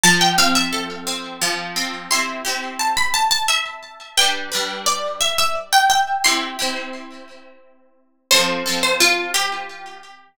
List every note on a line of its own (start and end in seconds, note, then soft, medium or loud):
0.03 1.41 F3 loud
0.03 0.20 A5 medium
0.21 0.37 G5 medium
0.38 1.06 C4 medium
0.38 0.55 F5 medium
0.55 1.31 E5 medium
0.73 2.04 A4 medium
1.07 1.76 C4 medium
1.42 2.07 F3 loud
1.76 2.09 C4 medium
2.11 2.42 C4 medium
2.11 2.42 E4 medium
2.11 2.42 G4 medium
2.11 2.40 C6 medium
2.45 4.03 C4 medium
2.45 4.03 E4 medium
2.45 4.03 G4 medium
2.79 2.96 A5 medium
2.97 3.13 B5 medium
3.14 3.30 A5 medium
3.31 3.47 A5 medium
3.48 4.10 E5 medium
4.17 4.49 G3 medium
4.17 4.49 D4 medium
4.17 4.49 B4 medium
4.17 4.46 G5 medium
4.52 6.10 G3 medium
4.52 6.10 D4 medium
4.52 6.10 B4 medium
4.86 5.15 D5 medium
5.21 5.37 E5 medium
5.38 5.55 E5 medium
5.73 5.89 G5 medium
5.90 6.23 G5 medium
6.24 6.56 C4 medium
6.24 6.56 E4 medium
6.24 6.56 G4 medium
6.24 7.94 C6 medium
6.59 8.17 C4 medium
6.59 8.17 E4 medium
6.59 8.17 G4 medium
8.31 8.63 F3 medium
8.31 8.63 C4 medium
8.31 8.63 A4 medium
8.31 8.82 C5 medium
8.66 10.24 F3 medium
8.66 10.24 C4 medium
8.66 10.24 A4 medium
8.83 8.99 C5 medium
9.00 9.30 F4 medium
9.34 10.01 G4 medium